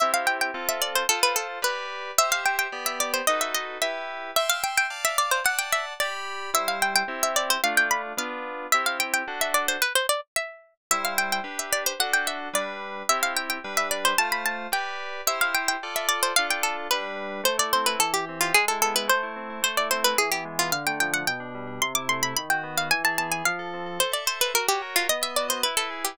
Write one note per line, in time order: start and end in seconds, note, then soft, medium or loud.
0.00 0.51 C4 medium
0.00 0.51 E4 medium
0.00 0.51 G4 medium
0.00 0.12 E5 loud
0.14 0.26 F5 medium
0.27 0.38 G5 medium
0.41 0.66 G5 medium
0.54 1.03 C4 medium
0.54 1.03 F4 medium
0.54 1.03 A4 medium
0.69 0.80 E5 medium
0.82 0.93 D5 medium
0.95 1.07 C5 medium
1.09 1.59 F4 medium
1.09 1.20 A4 loud
1.09 1.59 A4 medium
1.09 1.59 C5 medium
1.23 1.36 B4 medium
1.36 1.47 A4 medium
1.62 2.11 G4 medium
1.62 2.11 B4 medium
1.62 1.87 B4 medium
1.62 2.11 D5 medium
2.18 2.67 G4 medium
2.18 2.67 C5 medium
2.18 2.67 E5 medium
2.18 2.30 E5 loud
2.32 2.43 F5 medium
2.46 2.57 G5 medium
2.59 2.83 G5 medium
2.72 3.21 B3 medium
2.72 3.21 G4 medium
2.72 3.21 D5 medium
2.86 2.99 E5 medium
3.00 3.12 D5 medium
3.14 3.26 C5 medium
3.27 3.77 D#4 medium
3.27 3.77 F#4 medium
3.27 3.77 A4 medium
3.27 3.77 B4 medium
3.27 3.40 D#5 loud
3.41 3.53 E5 medium
3.54 3.67 D#5 medium
3.82 4.31 E4 medium
3.82 4.31 G4 medium
3.82 4.31 B4 medium
3.82 4.08 E5 medium
4.36 4.49 E5 loud
4.36 4.86 E5 medium
4.36 4.86 G5 medium
4.36 4.86 C6 medium
4.49 4.62 F5 loud
4.64 4.76 G5 medium
4.77 5.04 G5 medium
4.90 5.39 D5 medium
4.90 5.39 F5 medium
4.90 5.39 A5 medium
5.05 5.17 E5 loud
5.18 5.31 D5 medium
5.31 5.44 C5 medium
5.44 5.93 D5 medium
5.44 5.93 F#5 medium
5.44 5.59 F#5 loud
5.44 5.93 A5 medium
5.59 5.71 G5 medium
5.72 5.85 E5 medium
6.00 6.50 G4 medium
6.00 6.38 D5 medium
6.00 6.50 D5 medium
6.00 6.50 B5 medium
6.54 7.03 G3 medium
6.54 7.03 E4 medium
6.54 7.03 C5 medium
6.54 6.68 E5 loud
6.68 6.80 F5 medium
6.82 6.94 G5 medium
6.96 7.18 G5 loud
7.08 7.57 C4 medium
7.08 7.57 E4 medium
7.08 7.57 G4 medium
7.23 7.36 E5 medium
7.36 7.49 D5 medium
7.50 7.61 C5 medium
7.64 8.13 A3 medium
7.64 8.13 D4 medium
7.64 8.13 F4 medium
7.64 7.75 F5 loud
7.77 7.89 G5 loud
7.91 8.02 B5 medium
8.17 8.66 B3 medium
8.17 8.66 D4 medium
8.17 8.66 F4 medium
8.17 8.57 F5 medium
8.72 9.23 C4 medium
8.72 9.23 E4 medium
8.72 9.23 G4 medium
8.72 8.85 E5 loud
8.86 8.98 F5 medium
9.00 9.13 G5 medium
9.14 9.38 G5 medium
9.28 9.77 D4 medium
9.28 9.77 F#4 medium
9.28 9.77 A4 medium
9.41 9.54 E5 medium
9.54 9.67 D5 medium
9.68 9.81 C5 medium
9.82 9.93 B4 loud
9.95 10.07 C5 medium
10.09 10.21 D5 medium
10.36 10.74 E5 medium
10.91 11.40 G3 medium
10.91 11.40 E4 medium
10.91 11.40 C5 medium
10.91 11.02 E5 loud
11.05 11.16 F5 medium
11.18 11.31 G5 medium
11.32 11.58 G5 medium
11.44 11.93 D4 medium
11.44 11.93 G4 medium
11.44 11.93 B4 medium
11.59 11.70 E5 medium
11.73 11.84 D5 medium
11.86 11.99 C5 medium
12.00 12.49 D4 medium
12.00 12.49 F#4 medium
12.00 12.49 A4 medium
12.00 12.12 F#5 loud
12.13 12.27 G5 medium
12.27 12.39 E5 medium
12.53 13.03 G3 medium
12.53 13.03 D4 medium
12.53 13.03 B4 medium
12.53 12.78 D5 medium
13.09 13.58 C4 medium
13.09 13.58 E4 medium
13.09 13.58 G4 medium
13.09 13.20 E5 loud
13.23 13.34 F5 medium
13.37 13.49 G5 medium
13.50 13.75 G5 medium
13.64 14.13 G3 medium
13.64 14.13 D4 medium
13.64 14.13 B4 medium
13.77 13.89 E5 medium
13.91 14.04 D5 medium
14.05 14.17 C5 medium
14.18 14.67 A3 medium
14.18 14.67 F4 medium
14.18 14.67 C5 medium
14.18 14.29 A5 loud
14.32 14.43 B5 medium
14.46 14.58 A5 medium
14.72 15.21 G4 medium
14.72 15.21 B4 medium
14.72 15.21 D5 medium
14.72 14.98 G5 medium
15.27 15.76 E4 medium
15.27 15.76 G4 medium
15.27 15.76 C5 medium
15.27 15.39 E5 loud
15.41 15.54 F5 medium
15.55 15.67 G5 medium
15.68 15.93 G5 medium
15.83 16.32 F4 medium
15.83 16.32 A4 medium
15.83 16.32 D5 medium
15.96 16.07 E5 medium
16.09 16.20 D5 medium
16.23 16.35 C5 medium
16.36 16.87 D4 medium
16.36 16.87 F4 medium
16.36 16.87 A4 medium
16.36 16.47 F5 loud
16.51 16.62 G5 medium
16.63 16.77 A4 medium
16.91 17.41 G3 medium
16.91 17.41 D4 medium
16.91 17.15 B4 medium
16.91 17.41 B4 medium
17.44 17.95 A3 medium
17.44 17.57 C5 loud
17.58 17.86 E4 medium
17.58 17.72 D5 medium
17.73 18.01 C4 medium
17.73 17.86 C5 medium
17.86 18.00 E4 medium
17.86 17.99 B4 medium
17.99 18.51 E3 medium
17.99 18.13 A4 medium
18.14 18.25 G4 medium
18.14 18.41 G4 medium
18.29 18.55 C4 medium
18.41 18.53 F4 medium
18.41 18.55 G4 medium
18.54 19.06 G#3 medium
18.54 18.65 G#4 loud
18.68 18.95 E4 medium
18.68 18.80 A4 medium
18.82 19.07 B3 medium
18.82 18.95 A4 loud
18.95 19.08 E4 medium
18.95 19.09 B4 medium
19.08 19.60 A3 medium
19.08 19.35 C5 medium
19.23 19.49 E4 medium
19.36 19.62 C4 medium
19.50 19.63 E4 medium
19.62 20.14 A3 medium
19.62 19.77 C5 medium
19.77 20.04 E4 medium
19.77 19.89 D5 medium
19.91 20.17 C4 medium
19.91 20.04 C5 medium
20.04 20.18 E4 medium
20.04 20.17 B4 loud
20.18 20.70 E3 medium
20.18 20.30 G#4 medium
20.32 20.58 B3 medium
20.32 20.44 G4 medium
20.45 20.71 G#3 medium
20.59 20.72 B3 medium
20.59 20.71 F4 medium
20.72 21.23 D3 medium
20.72 20.85 F5 loud
20.87 21.13 A3 medium
20.87 20.99 G5 medium
21.00 21.28 F3 medium
21.00 21.13 G5 medium
21.13 21.26 A3 medium
21.13 21.25 F#5 medium
21.27 21.79 B2 medium
21.27 21.65 G5 medium
21.40 21.67 D4 medium
21.55 21.81 G3 medium
21.67 21.80 D4 medium
21.82 22.34 C3 medium
21.82 21.93 C6 loud
21.95 22.24 E4 medium
21.95 22.08 D6 medium
22.09 22.35 A3 medium
22.09 22.22 C6 medium
22.23 22.37 E4 medium
22.23 22.34 B5 medium
22.37 22.90 D#3 medium
22.37 22.49 B5 medium
22.50 22.76 F#4 medium
22.50 22.63 G5 medium
22.63 22.89 B3 medium
22.77 22.90 F#4 medium
22.77 22.89 F5 medium
22.91 23.42 E3 medium
22.91 23.03 G#5 loud
23.04 23.31 G#4 medium
23.04 23.18 A5 medium
23.18 23.45 B3 medium
23.18 23.30 A5 medium
23.31 23.44 G#4 medium
23.31 23.44 G#5 medium
23.45 23.98 F3 medium
23.45 23.68 F5 medium
23.59 23.86 A4 medium
23.74 24.00 C4 medium
23.86 23.99 A4 medium
23.99 24.51 A4 medium
23.99 24.12 C5 loud
24.12 24.25 D5 medium
24.12 24.40 E5 medium
24.26 24.52 C5 medium
24.26 24.39 C5 medium
24.40 24.53 B4 medium
24.40 24.53 E5 medium
24.54 25.06 F#4 medium
24.54 24.67 A#4 medium
24.68 24.82 G4 medium
24.68 24.96 C#5 medium
24.82 25.08 A#4 medium
24.96 25.07 F4 medium
24.96 25.09 C#5 medium
25.09 25.62 B3 medium
25.09 25.22 D#5 loud
25.21 25.48 D#5 medium
25.21 25.35 E5 medium
25.36 25.63 F#4 medium
25.36 25.47 D5 medium
25.48 25.61 C5 medium
25.48 25.61 D#5 medium
25.63 26.17 E4 medium
25.63 25.75 B4 medium
25.77 25.90 A4 medium
25.77 26.04 B4 medium
25.90 26.16 G#4 medium
26.05 26.18 G4 medium
26.05 26.18 B4 medium